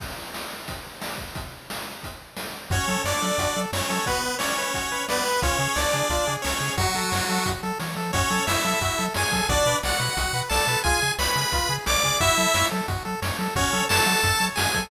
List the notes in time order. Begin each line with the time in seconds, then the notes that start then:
0.00 kick, crash
0.34 snare
0.68 kick, closed hi-hat
1.02 snare
1.18 kick
1.35 kick, closed hi-hat
1.70 snare
2.03 kick, closed hi-hat
2.37 snare
2.70 F#2 C#4 F#4 C#5, kick, closed hi-hat
2.88 F#3 A4, closed hi-hat
3.04 F#2 D4 C#5 D5, snare
3.22 F#3 A4, closed hi-hat
3.38 F#2 F#4, kick, closed hi-hat
3.56 F#3 A4, closed hi-hat
3.73 F#2 C#4 C#5, snare
3.90 F#3 A4, closed hi-hat
4.06 B3 F#4 B4, kick, closed hi-hat
4.23 B4, closed hi-hat
4.39 C#4 C#5 D5, snare
4.57 B4, closed hi-hat
4.74 F#4, kick, closed hi-hat
4.92 B4, closed hi-hat
5.08 B3 B4 D5, snare
5.25 B4, closed hi-hat
5.42 C#2 C#4 F4 C#5, kick, closed hi-hat
5.59 C#3 G#4, closed hi-hat
5.76 C#2 D4 C#5 D5, snare
5.93 C#3 G#4, closed hi-hat
6.10 C#2 F4, kick, closed hi-hat
6.27 C#3 G#4, closed hi-hat
6.42 C#2 C#4 C#5, snare
6.61 C#3 G#4, closed hi-hat
6.77 F#2 F#3 F#4, kick, closed hi-hat
6.95 F#3 A4, closed hi-hat
7.12 F#2 C#5, snare
7.29 F#3 A4, closed hi-hat
7.46 F#2 F#4, kick, closed hi-hat
7.63 F#3 A4, closed hi-hat
7.79 E3 C#5, snare
7.96 F3 A4, closed hi-hat
8.13 F#2 C#4 F#4 C#5, kick, closed hi-hat
8.30 F#3 A4, closed hi-hat
8.47 F#2 E4 C#5 E5, snare
8.64 F#3 A4, closed hi-hat
8.81 F#2 F#4, kick, closed hi-hat
8.98 F#3 A4, closed hi-hat
9.14 F#2 G#4 C#5 G#5, snare
9.32 F#3 A4, kick, closed hi-hat
9.49 B1 D4 F#4 D5, kick, closed hi-hat
9.66 B2 B4, closed hi-hat
9.83 B1 F#4 D5 F#5, snare
10.00 B2 B4, closed hi-hat
10.17 B1 F#4, kick, closed hi-hat
10.33 B2 B4, closed hi-hat
10.49 B1 A4 D5 A5, snare
10.67 B2 B4, closed hi-hat
10.84 C#2 F4 G#4 G#5, kick, closed hi-hat
11.02 C#3 G#4, closed hi-hat
11.19 C#2 B4 C#5 B5, snare
11.36 C#3 G#4, closed hi-hat
11.52 C#2 F4, kick, closed hi-hat
11.69 C#3 G#4, closed hi-hat
11.86 B1 C#5 D5 D6, snare
12.03 C#3 G#4, kick, closed hi-hat
12.20 F#2 E4 F#4 E5, kick, closed hi-hat
12.37 F#3 A4, closed hi-hat
12.54 F#2 C#5, snare
12.71 F#3 A4, closed hi-hat
12.88 F#2 F#4, kick, closed hi-hat
13.05 F#3 A4, closed hi-hat
13.22 F#2 C#5, snare
13.39 F#3 A4, closed hi-hat
13.56 F#2 C#4 F#4 C#5, kick, closed hi-hat
13.73 F#3 A4, closed hi-hat
13.89 F#2 A4 C#5 A5, snare
14.06 F#3 F#4, closed hi-hat
14.23 F#2 A4, kick, closed hi-hat
14.40 F#3 C#5, closed hi-hat
14.56 F#2 F#4 G#4 G#5, snare
14.74 F#3 A4, kick, closed hi-hat